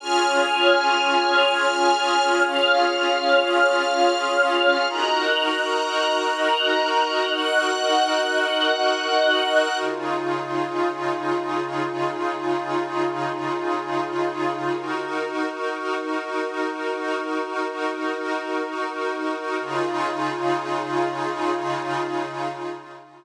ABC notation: X:1
M:4/4
L:1/8
Q:1/4=98
K:Db
V:1 name="Pad 5 (bowed)"
[DFA]8- | [DFA]8 | [EGB]8- | [EGB]8 |
[D,EFA]8- | [D,EFA]8 | [EGB]8- | [EGB]8 |
[D,EFA]8 |]
V:2 name="String Ensemble 1"
[daf']8 | [dff']8 | [ebg']8 | [egg']8 |
z8 | z8 | z8 | z8 |
z8 |]